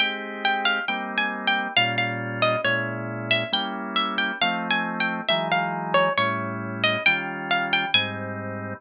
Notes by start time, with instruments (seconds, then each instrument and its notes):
0.00 drawbar organ G#3 C4 D#4 G4, pizzicato strings G5
0.45 pizzicato strings G5
0.65 pizzicato strings F5
0.88 drawbar organ G3 A#3 C4 D#4, pizzicato strings G5
1.18 pizzicato strings G#5
1.47 pizzicato strings G5
1.77 drawbar organ A#2 G3 C#4 F4, pizzicato strings F5
1.98 pizzicato strings F5
2.42 pizzicato strings D#5
2.64 drawbar organ A#2 G#3 C#4 E4, pizzicato strings C#5
3.31 pizzicato strings E5
3.52 drawbar organ G3 A#3 C#4 E4, pizzicato strings G5
3.96 pizzicato strings E5
4.18 pizzicato strings G5
4.42 drawbar organ F3 A3 C4 D#4, pizzicato strings F5
4.71 pizzicato strings G#5
5.00 pizzicato strings G5
5.29 drawbar organ E3 F#3 G#3 D#4, pizzicato strings E5
5.52 pizzicato strings F5
5.94 pizzicato strings C#5
6.18 drawbar organ A2 G3 C#4 E4, pizzicato strings C#5
6.84 pizzicato strings D#5
7.06 drawbar organ D#3 G3 C#4 F4, pizzicato strings G5
7.51 pizzicato strings F5
7.73 pizzicato strings G5
7.94 drawbar organ G#2 G3 C4 D#4, pizzicato strings G#5